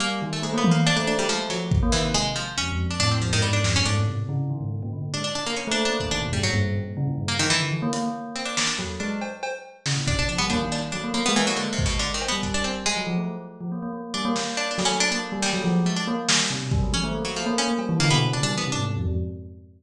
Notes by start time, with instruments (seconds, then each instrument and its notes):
0.00 tubular bells G3, harpsichord A#3
0.22 tubular bells D#3
0.33 harpsichord A3
0.42 harpsichord G#3, tubular bells A3
0.53 tubular bells A#3
0.58 harpsichord B3
0.64 high tom
0.71 harpsichord A#3
0.75 tubular bells A#3
0.86 harpsichord D4, cowbell
0.97 tubular bells A3, harpsichord D4
1.07 harpsichord D4
1.18 tubular bells F#3, harpsichord G3
1.28 harpsichord F3, tubular bells G#3
1.39 tubular bells A3
1.50 tubular bells F3, harpsichord F#3, closed hi-hat
1.71 kick
1.83 tubular bells A#3
1.92 tubular bells D#3, harpsichord E3, clap
2.04 tubular bells C3
2.14 harpsichord G#3
2.36 harpsichord F3
2.58 tubular bells F2, harpsichord C#4
2.72 tubular bells F2
2.86 tubular bells F2
2.91 harpsichord D4
3.00 tubular bells A2, harpsichord D4, closed hi-hat
3.11 harpsichord C4
3.21 tubular bells F2, harpsichord F3
3.32 tubular bells G#2, harpsichord D#3
3.42 harpsichord G3
3.53 harpsichord D4
3.64 tubular bells F2, snare
3.74 tubular bells G2, harpsichord C#4
3.86 tubular bells G#2, harpsichord D4
3.97 tubular bells A2
4.08 tubular bells C3
4.29 tubular bells C#3
4.50 tubular bells D#3
4.61 tubular bells G#2
4.83 tubular bells A#2
4.92 tubular bells D3
5.14 tubular bells G#3, harpsichord D4
5.24 harpsichord D4
5.35 harpsichord D4
5.46 tubular bells A#3, harpsichord A#3
5.56 harpsichord C#4
5.67 tubular bells A3
5.71 harpsichord D4
5.85 harpsichord D4
5.89 tubular bells A#3
6.00 harpsichord D4, kick
6.11 tubular bells D#3, harpsichord D4
6.21 tubular bells B2, floor tom
6.33 tubular bells G2, harpsichord G3
6.43 tubular bells G#2, harpsichord F#3
6.54 tubular bells G2
6.75 tubular bells A#2
6.97 tubular bells C#3
7.07 tubular bells A#2
7.18 tubular bells G2
7.28 harpsichord A#3
7.39 harpsichord D#3, tubular bells D#3
7.50 harpsichord E3
7.60 tubular bells D3
7.72 tubular bells E3
7.82 tubular bells A#3
7.93 tubular bells A#3, closed hi-hat
8.03 tubular bells A#3
8.36 harpsichord C4
8.45 harpsichord D4
8.57 tubular bells A#3, harpsichord D4, snare
8.67 harpsichord D4
8.79 tubular bells F#3, floor tom
9.00 tubular bells G#3, harpsichord D4
9.21 cowbell
9.43 cowbell
9.86 tubular bells C#3, snare
9.97 tubular bells A#2
10.07 tubular bells B2, harpsichord D4, kick
10.19 harpsichord D4
10.29 tubular bells F3, harpsichord D4
10.38 tubular bells G3, harpsichord B3
10.50 tubular bells A#3, harpsichord D4, kick
10.61 tubular bells D#3
10.71 harpsichord D4, clap
10.92 tubular bells F#3, harpsichord D4
11.04 tubular bells A#3
11.14 harpsichord A#3, tubular bells A#3
11.26 tubular bells G#3, harpsichord B3
11.36 harpsichord E3
11.43 harpsichord F#3, tubular bells A#3
11.56 harpsichord D3, tubular bells G#3
11.73 harpsichord C3
11.79 kick
11.86 harpsichord B2
11.99 harpsichord D3
12.14 harpsichord D#3
12.21 cowbell
12.28 tubular bells G3, harpsichord B3
12.43 harpsichord D4, kick
12.54 harpsichord D4
12.64 harpsichord C4, cowbell
12.86 tubular bells G#3, harpsichord G#3
12.97 tubular bells F#3
13.07 tubular bells F3
13.18 tubular bells A3
13.61 tubular bells F3
13.72 tubular bells A#3
13.82 tubular bells A#3
13.93 tubular bells A#3
14.14 tubular bells G3, harpsichord D4
14.25 tubular bells A#3
14.36 tubular bells A#3, snare
14.57 harpsichord D4
14.71 harpsichord D4
14.78 tubular bells F#3, snare
14.85 tubular bells A3, harpsichord C#4
15.00 harpsichord D4
15.11 tubular bells A#3, harpsichord D4
15.32 tubular bells G3
15.42 harpsichord G3, tubular bells A#3, snare
15.53 tubular bells F#3
15.64 tubular bells F3
15.85 tubular bells G#3, harpsichord A3
15.96 harpsichord D4
16.07 tubular bells A#3
16.28 tubular bells G3, snare
16.50 tubular bells C3
16.61 tubular bells B2
16.71 tubular bells G3, kick
16.82 tubular bells F#3
16.93 harpsichord C#4, high tom
17.04 tubular bells A3
17.14 tubular bells A#3
17.25 harpsichord F#3
17.36 harpsichord F3, tubular bells A3
17.46 tubular bells A#3
17.58 harpsichord C#4
17.68 tubular bells A#3
17.78 tubular bells G3, cowbell
17.89 tubular bells E3
18.00 tubular bells D3, harpsichord A#3, closed hi-hat
18.10 tubular bells B2, harpsichord B3
18.32 tubular bells C#3, harpsichord D4
18.43 tubular bells G3, harpsichord D4
18.54 tubular bells E3, harpsichord B3
18.64 tubular bells C3
18.72 tubular bells G#2, harpsichord D4
18.97 tubular bells F2
19.07 tubular bells F2